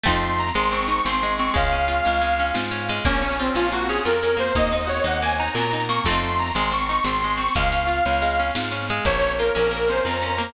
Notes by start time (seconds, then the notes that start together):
0.04 F2 A3 C4 D#4 C6, kick, snare
0.09 F4, snare
0.22 C6, snare
0.29 snare
0.38 A#5, snare
0.47 snare
0.55 G#1 G#3 C6, snare
0.64 snare
0.72 C4 C#6, snare
0.81 snare
0.88 D#4 C#6, snare
0.97 snare
1.05 G#1 C4 C6, snare
1.13 snare
1.23 G#3, snare
1.29 snare
1.38 C4 C#6, snare
1.47 snare
1.54 C#2 G#3 F5, kick, snare
1.64 snare
1.71 C#4, snare
1.80 snare
1.88 F4, snare
1.96 snare
2.05 C#2 C#4, snare
2.14 snare
2.21 G#3, snare
2.30 snare
2.39 C#4, snare
2.47 snare
2.54 G#2 F4, snare
2.64 snare
2.71 C#4, snare
2.79 snare
2.89 G#3, snare
2.97 snare
3.05 A#1 A#3 C#4, kick, snare
3.15 snare
3.22 C#4, snare
3.29 snare
3.39 C4 F4, snare
3.46 snare
3.54 A#1 C#4 F4, snare
3.65 snare
3.72 A#3 F#4, snare
3.81 snare
3.89 C#4 G#4, snare
3.96 snare
4.05 F2 F4 A#4, snare
4.14 snare
4.23 C#4, snare
4.30 snare
4.37 A#3 C5, snare
4.46 snare
4.55 D#2 A#3 D#5, kick, snare
4.64 snare
4.72 D#4 D#5, snare
4.80 snare
4.87 F#4 C#5, snare
4.97 snare
5.04 D#2 D#4 F#5, snare
5.14 snare
5.22 A#3 G#5, snare
5.29 snare
5.39 D#4 A#5, snare
5.47 snare
5.55 A#2 F#4 A#5, snare
5.63 snare
5.71 D#4, snare
5.80 snare
5.89 A#3 C#6, snare
5.97 snare
6.05 F2 A3 C4 C6, kick, snare
6.10 D#4 F4
6.14 snare
6.22 C6, snare
6.30 snare
6.39 A#5, snare
6.46 snare
6.55 G#1 G#3 C6, snare
6.64 snare
6.71 C4 C#6, snare
6.80 snare
6.89 D#4 C#6, snare
6.96 snare
7.04 G#1 C4 C6, snare
7.14 snare
7.22 G#3, snare
7.30 snare
7.37 C4 C#6, snare
7.48 snare
7.55 C#2 G#3 F5, kick, snare
7.63 snare
7.71 C#4, snare
7.81 snare
7.87 F4, snare
7.96 snare
8.05 C#2 C#4, snare
8.13 snare
8.22 G#3, snare
8.31 snare
8.39 C#4, snare
8.48 snare
8.55 G#2 F4, snare
8.63 snare
8.71 C#4, snare
8.81 snare
8.88 G#3, snare
8.96 snare
9.05 A#1 A#3 C#5, kick, snare
9.13 snare
9.21 C#4, snare
9.31 snare
9.38 F4 A#4, snare
9.47 snare
9.55 A#1 C#4 A#4, snare
9.64 snare
9.71 A#3 A#4, snare
9.80 snare
9.88 C#4 C5, snare
9.97 snare
10.05 F2 F4 A#5, snare
10.14 snare
10.22 C#4, snare
10.30 snare
10.38 A#3, snare
10.48 snare